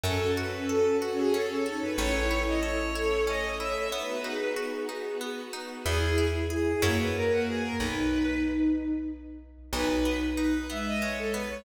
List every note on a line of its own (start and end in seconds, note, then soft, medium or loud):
0.03 1.82 F#2 loud
0.03 0.34 C#4 medium
0.03 1.00 C#4 medium
0.03 1.57 C#4 medium
0.03 1.01 F#4 medium
0.03 0.32 A4 medium
0.03 1.00 A4 medium
0.37 0.66 F#4 medium
0.37 0.65 B4 medium
0.69 0.98 A4 medium
0.69 0.97 A4 medium
1.00 1.96 C#4 medium
1.00 1.17 F#4 medium
1.00 1.31 F#4 medium
1.00 1.96 A4 medium
1.00 1.96 C#5 medium
1.18 1.33 G#4 medium
1.34 1.63 C#4 medium
1.34 1.49 A4 medium
1.50 1.65 A4 medium
1.66 1.96 D#4 medium
1.66 1.95 F#4 medium
1.66 1.81 A4 medium
1.82 1.98 B4 medium
1.98 3.76 A1 medium
1.98 2.27 C#4 medium
1.98 2.94 C#4 medium
1.98 2.76 E4 medium
1.98 2.94 E4 medium
1.98 2.94 A4 medium
1.98 2.42 C#5 loud
2.31 2.60 E4 medium
2.47 2.62 D#5 medium
2.62 2.92 A4 medium
2.62 3.24 C#5 medium
2.94 3.91 A3 medium
2.94 3.91 C#4 medium
2.94 3.24 E4 medium
2.94 3.24 A4 medium
2.94 3.91 A4 medium
3.27 3.56 C#4 medium
3.27 3.58 C#5 medium
3.27 3.55 D#5 medium
3.59 3.89 E4 medium
3.59 3.88 C#5 medium
3.59 3.89 E5 medium
3.91 4.21 B3 medium
3.91 4.89 B3 medium
3.91 4.89 D#4 medium
3.91 4.89 F#4 medium
3.91 4.22 B4 medium
3.91 4.48 B4 medium
4.24 4.53 D#4 medium
4.24 5.15 G#4 medium
4.56 4.85 F#4 medium
4.89 5.86 B3 medium
4.89 5.18 D#4 medium
4.89 5.86 F#4 medium
4.89 5.86 B4 medium
5.21 5.50 B3 medium
5.53 5.82 D#4 medium
5.85 6.75 E2 loud
5.85 6.15 B3 medium
5.85 6.72 E4 medium
5.85 6.25 G#4 medium
6.18 6.47 E4 medium
6.50 6.79 G#4 medium
6.50 6.82 G#4 medium
6.82 7.72 F#2 medium
6.82 7.69 A#3 medium
6.82 7.74 A#3 medium
6.82 7.69 C#4 medium
6.82 7.69 E4 medium
6.82 7.69 F#4 loud
6.82 6.97 C#5 medium
6.99 7.14 B4 medium
7.15 7.30 A#4 medium
7.31 7.46 F#4 medium
7.47 7.62 G#4 medium
7.62 7.78 A#4 medium
7.78 9.58 B1 medium
7.78 8.91 D#4 medium
7.78 8.37 B4 medium
9.73 11.51 B1 medium
9.73 10.02 G#3 medium
9.73 10.57 D#4 medium
9.73 10.16 B4 medium
10.05 10.34 B3 medium
10.37 10.66 D#4 medium
10.37 10.67 B4 medium
10.70 11.59 G#3 medium
10.70 10.99 B3 medium
10.70 10.85 E5 medium
10.86 11.02 D#5 medium
11.01 11.31 G#3 medium
11.01 11.16 C#5 medium
11.18 11.33 A4 medium
11.34 11.63 B3 medium
11.34 11.49 B4 medium
11.50 11.64 C#5 medium